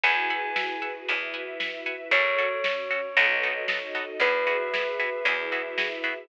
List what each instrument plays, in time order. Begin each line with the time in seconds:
0.03 electric bass (finger) E2, string ensemble 1 E4 F#4 G#4 B4, pizzicato strings E5 F#5 G#5 B5, tubular bells G#5, kick, closed hi-hat
0.30 pizzicato strings E5 F#5 G#5 B5
0.56 pizzicato strings E5 F#5 G#5 B5, snare
0.82 pizzicato strings E5 F#5 G#5 B5
1.08 electric bass (finger) E2, string ensemble 1 E4 F#4 B4 E5, pizzicato strings E5 F#5 G#5 B5, closed hi-hat
1.34 pizzicato strings E5 F#5 G#5 B5
1.60 pizzicato strings E5 F#5 G#5 B5, snare
1.86 pizzicato strings E5 F#5 G#5 B5
2.11 electric bass (finger) F#2, pizzicato strings C#4 F#4 A4, string ensemble 1 F#4 A4 C#5, tubular bells C#5, kick, closed hi-hat
2.38 pizzicato strings C#4 F#4 A4
2.64 string ensemble 1 C#4 F#4 C#5, pizzicato strings C#4 F#4 A4, snare
2.91 pizzicato strings C#4 F#4 A4
3.17 electric bass (finger) B1, pizzicato strings B3 D#4 F#4 A4, string ensemble 1 F#4 A4 B4 D#5, closed hi-hat
3.43 pizzicato strings B3 D#4 F#4 A4
3.68 pizzicato strings B3 D#4 F#4 A4, string ensemble 1 D#4 F#4 A4 D#5, snare
3.95 pizzicato strings B3 D#4 F#4 A4
4.20 electric bass (finger) E2, pizzicato strings B3 E4 F#4 G#4, string ensemble 1 F#4 G#4 B4 E5, tubular bells B4, kick, closed hi-hat
4.47 pizzicato strings B3 E4 F#4 G#4
4.73 pizzicato strings B3 E4 F#4 G#4, snare
4.99 pizzicato strings B3 E4 F#4 G#4
5.25 electric bass (finger) E2, pizzicato strings B3 E4 F#4 G#4, string ensemble 1 E4 F#4 G#4 E5, closed hi-hat
5.52 pizzicato strings B3 E4 F#4 G#4
5.78 pizzicato strings B3 E4 F#4 G#4, snare
6.04 pizzicato strings B3 E4 F#4 G#4